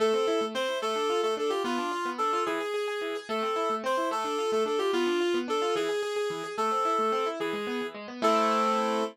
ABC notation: X:1
M:6/8
L:1/8
Q:3/8=146
K:Am
V:1 name="Clarinet"
A4 c2 | A3 A A G | F4 A2 | ^G6 |
A4 c2 | A3 A A G | F4 A2 | ^G6 |
A6 | ^G4 z2 | A6 |]
V:2 name="Acoustic Grand Piano"
A, C E A, C E | A, D F A, D F | B, D F B, D F | E, ^G G G E, G |
A, C E A, C E | A, D F A, D F | B, D F B, D F | E, ^G G G E, G |
A, C E A, C E | E, ^G, B, E, G, B, | [A,CE]6 |]